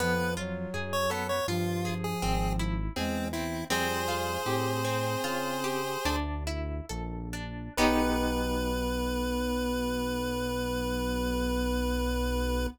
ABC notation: X:1
M:5/4
L:1/16
Q:1/4=81
K:Bdor
V:1 name="Lead 1 (square)"
B2 z3 c A c ^E3 G3 z2 ^B,2 =E2 | "^rit." [G=c]14 z6 | B20 |]
V:2 name="Flute"
^E,2 F,6 E,8 G,2 z2 | "^rit." =G,4 =C8 z8 | B,20 |]
V:3 name="Acoustic Guitar (steel)"
B,2 ^E2 G2 B,2 E2 G2 ^B,2 =E2 G2 B,2 | "^rit." =C2 =F2 =G2 C2 F2 G2 D2 E2 A2 D2 | [B,^D=G]20 |]
V:4 name="Synth Bass 1" clef=bass
^E,,4 F,,4 =G,,4 ^G,,,4 =E,,4 | "^rit." =F,,4 A,,4 C,4 D,,4 ^A,,,4 | B,,,20 |]